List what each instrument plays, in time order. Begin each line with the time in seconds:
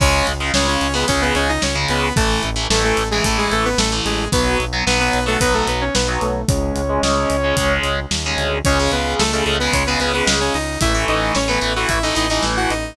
0.00 synth bass 1 C#2, overdriven guitar C#3 G#3, lead 2 (sawtooth) C#4 C#5, kick, crash
0.27 synth bass 1 C#2, closed hi-hat
0.40 overdriven guitar C#3 G#3
0.54 synth bass 1 C#2, overdriven guitar C#3 G#3, lead 2 (sawtooth) C#4 C#5, snare
0.68 lead 2 (sawtooth) C#4 C#5
0.81 synth bass 1 C#2, closed hi-hat
0.94 overdriven guitar C#3 G#3, lead 2 (sawtooth) B3 B4
1.08 synth bass 1 C#2, overdriven guitar C#3 G#3, lead 2 (sawtooth) C#4 C#5, kick, closed hi-hat
1.22 lead 2 (sawtooth) B3 B4
1.35 synth bass 1 C#2, lead 2 (sawtooth) C#4 C#5, closed hi-hat
1.49 lead 2 (sawtooth) D#4 D#5
1.62 synth bass 1 C#2, lead 2 (sawtooth) C#4 C#5, snare
1.75 overdriven guitar C#3 G#3
1.89 synth bass 1 C#2, lead 2 (sawtooth) B3 B4, closed hi-hat
2.16 synth bass 1 A1, overdriven guitar E3 A3, lead 2 (sawtooth) A3 A4, kick, closed hi-hat
2.43 synth bass 1 A1, closed hi-hat
2.56 overdriven guitar E3 A3
2.70 synth bass 1 A1, overdriven guitar E3 A3, lead 2 (sawtooth) A3 A4, snare
2.84 lead 2 (sawtooth) A3 A4
2.97 synth bass 1 A1, closed hi-hat
3.11 overdriven guitar E3 A3, lead 2 (sawtooth) G#3 G#4
3.24 synth bass 1 A1, overdriven guitar E3 A3, lead 2 (sawtooth) A3 A4, kick, closed hi-hat
3.38 lead 2 (sawtooth) G#3 G#4
3.51 synth bass 1 A1, lead 2 (sawtooth) A3 A4, closed hi-hat
3.65 lead 2 (sawtooth) B3 B4
3.78 synth bass 1 A1, lead 2 (sawtooth) A3 A4, snare
3.92 overdriven guitar E3 A3
4.05 synth bass 1 A1, lead 2 (sawtooth) G#3 G#4, closed hi-hat
4.32 synth bass 1 B1, overdriven guitar F#3 B3, lead 2 (sawtooth) B3 B4, kick, closed hi-hat
4.60 synth bass 1 B1, closed hi-hat
4.73 overdriven guitar F#3 B3
4.86 synth bass 1 B1, overdriven guitar F#3 B3, lead 2 (sawtooth) B3 B4, snare
5.00 lead 2 (sawtooth) B3 B4
5.13 synth bass 1 B1, closed hi-hat
5.26 overdriven guitar F#3 B3, lead 2 (sawtooth) A3 A4
5.40 synth bass 1 B1, overdriven guitar F#3 B3, lead 2 (sawtooth) B3 B4, kick, closed hi-hat
5.54 lead 2 (sawtooth) A3 A4
5.67 synth bass 1 B1, lead 2 (sawtooth) B3 B4, closed hi-hat
5.81 lead 2 (sawtooth) C#4 C#5
5.94 synth bass 1 B1, lead 2 (sawtooth) B3 B4, snare
6.08 overdriven guitar F#3 B3
6.21 synth bass 1 B1, lead 2 (sawtooth) A3 A4, closed hi-hat
6.48 synth bass 1 C#2, overdriven guitar G#3 C#4, lead 2 (sawtooth) C#4 C#5, kick, closed hi-hat
6.76 synth bass 1 C#2, closed hi-hat
6.89 overdriven guitar G#3 C#4
7.02 synth bass 1 C#2, overdriven guitar G#3 C#4, snare
7.30 synth bass 1 C#2, closed hi-hat
7.44 overdriven guitar G#3 C#4
7.57 synth bass 1 C#2, overdriven guitar G#3 C#4, kick, closed hi-hat
7.83 synth bass 1 C#2, closed hi-hat
8.11 synth bass 1 D#2, snare
8.26 overdriven guitar G#3 C#4
8.37 synth bass 1 D2, closed hi-hat
8.65 synth bass 1 C#2, overdriven guitar C#3 G#3, lead 2 (sawtooth) C#4 C#5, kick, closed hi-hat
8.79 overdriven guitar C#3 G#3
8.91 synth bass 1 C#2, lead 2 (sawtooth) B3 B4, closed hi-hat
9.19 synth bass 1 C#2, lead 2 (sawtooth) A3 A4, snare
9.32 overdriven guitar C#3 G#3, lead 2 (sawtooth) A3 A4
9.46 synth bass 1 C#2, overdriven guitar C#3 G#3, closed hi-hat
9.59 overdriven guitar C#3 G#3, lead 2 (sawtooth) B3 B4
9.73 synth bass 1 C#2, lead 2 (sawtooth) C#4 C#5, kick, closed hi-hat
9.86 overdriven guitar C#3 G#3, lead 2 (sawtooth) B3 B4
9.99 synth bass 1 C#2, overdriven guitar C#3 G#3, lead 2 (sawtooth) B3 B4, closed hi-hat
10.14 overdriven guitar C#3 G#3, lead 2 (sawtooth) B3 B4
10.27 synth bass 1 C#2, snare
10.41 lead 2 (sawtooth) C#4 C#5
10.54 synth bass 1 C#2, lead 2 (sawtooth) D#4 D#5, open hi-hat
10.81 synth bass 1 A1, overdriven guitar E3 A3, lead 2 (sawtooth) E4 E5, kick, closed hi-hat
10.94 overdriven guitar E3 A3
11.08 synth bass 1 A1, lead 2 (sawtooth) D#4 D#5, closed hi-hat
11.35 synth bass 1 A1, lead 2 (sawtooth) C#4 C#5, snare
11.48 overdriven guitar E3 A3, lead 2 (sawtooth) B3 B4
11.61 synth bass 1 A1, overdriven guitar E3 A3, closed hi-hat
11.76 overdriven guitar E3 A3, lead 2 (sawtooth) F#4 F#5
11.89 synth bass 1 A1, lead 2 (sawtooth) E4 E5, kick, closed hi-hat
12.03 overdriven guitar E3 A3, lead 2 (sawtooth) D#4 D#5
12.15 synth bass 1 A1, overdriven guitar E3 A3, lead 2 (sawtooth) D#4 D#5, closed hi-hat
12.30 overdriven guitar E3 A3, lead 2 (sawtooth) D#4 D#5
12.43 synth bass 1 A1, snare
12.57 lead 2 (sawtooth) F#4 F#5
12.70 synth bass 1 A1, lead 2 (sawtooth) D#4 D#5, closed hi-hat